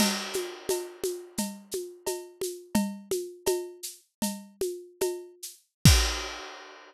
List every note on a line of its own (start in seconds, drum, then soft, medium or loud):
0.00 crash medium
0.00 cowbell medium
0.00 low conga medium
0.00 shaker medium
0.33 high conga medium
0.33 shaker medium
0.69 cowbell medium
0.69 high conga medium
0.69 shaker medium
1.04 high conga medium
1.04 shaker medium
1.38 cowbell medium
1.38 low conga medium
1.38 shaker medium
1.71 high conga medium
1.71 shaker medium
2.06 cowbell medium
2.06 high conga medium
2.06 shaker medium
2.41 high conga medium
2.41 shaker medium
2.75 cowbell medium
2.75 low conga medium
2.75 shaker medium
3.11 high conga medium
3.11 shaker medium
3.46 cowbell medium
3.46 high conga medium
3.46 shaker medium
3.83 shaker medium
4.22 cowbell medium
4.22 low conga medium
4.22 shaker medium
4.61 high conga medium
4.61 shaker medium
5.01 cowbell medium
5.01 high conga medium
5.01 shaker medium
5.43 shaker medium
5.85 kick loud
5.85 crash loud